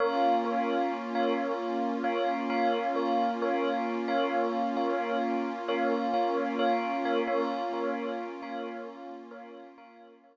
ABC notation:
X:1
M:4/4
L:1/16
Q:1/4=66
K:Bbdor
V:1 name="Tubular Bells"
[Bdf]2 [Bdf]3 [Bdf]4 [Bdf]2 [Bdf]2 [Bdf]2 [Bdf]- | [Bdf]2 [Bdf]3 [Bdf]4 [Bdf]2 [Bdf]2 [Bdf]2 [Bdf] | [Bdf]2 [Bdf]3 [Bdf]4 [Bdf]2 [Bdf]2 [Bdf]2 z |]
V:2 name="Pad 2 (warm)"
[B,DF]16- | [B,DF]16 | [B,DF]16 |]